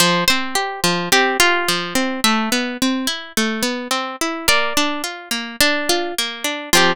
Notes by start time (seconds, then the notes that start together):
0.00 F3 C5
0.28 C4 C5
0.55 G4
0.84 F3
1.12 C4 G4
1.40 F4 G4
1.68 F3
1.95 C4
2.24 A3 E5
2.52 B3
2.82 C4
3.07 E4
3.37 A3
3.63 B3
3.91 C4
4.21 E4
4.48 A#3 D5
4.77 D4
5.04 F4
5.31 A#3
5.61 D4
5.89 F4
6.18 A#3
6.44 D4
6.73 F3 C4 F4 G4